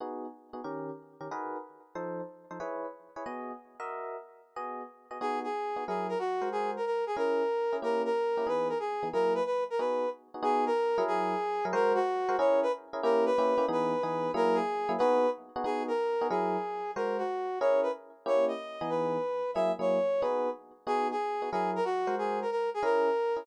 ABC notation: X:1
M:4/4
L:1/8
Q:"Swing" 1/4=184
K:B
V:1 name="Brass Section"
z8 | z8 | z8 | z8 |
G G3 G A F2 | G A A G A4 | A A3 B A G2 | A B B A B2 z2 |
G A3 G4 | A F3 c B z2 | A B3 B4 | A G3 B2 z2 |
G A3 G4 | A F3 c B z2 | c d3 B4 | e c3 B2 z2 |
G G3 G A F2 | G A A G A4 |]
V:2 name="Electric Piano 1"
[B,DFG]3 [B,DFG] [D,C=GA]3 [D,CGA] | [DFGAB]4 [=F,_E=A=c]3 [F,EAc] | [EGBc]3 [EGBc] [B,FGd]3 [FAde]- | [FAde]4 [B,FGd]3 [B,FGd] |
[B,DFG]3 [B,DFG] [F,EGA]3 [G,FA^B]- | [G,FA^B]4 [CEGA]3 [CEGA] | [A,CE=G]3 [A,CEG] [E,B,D^G]3 [E,B,DG] | [F,A,EG]4 [B,DFG]3 [B,DFG] |
[B,DFG]3 [F,EGA]4 [F,EGA] | [G,FA^B]3 [G,FAB] [CEGA]3 [CEGA] | [A,CE=G]2 [A,CEG] [A,CEG] [E,B,D^G]2 [E,B,DG]2 | [F,A,EG]3 [F,A,EG] [B,DFG]3 [B,DFG] |
[B,DFG]3 [B,DFG] [F,EGA]4 | [G,FA^B]4 [CEGA]4 | [A,CE=G]3 [E,B,D^G]5 | [F,A,EG] [F,A,EG]3 [B,DFG]4 |
[B,DFG]3 [B,DFG] [F,EGA]3 [G,FA^B]- | [G,FA^B]4 [CEGA]3 [CEGA] |]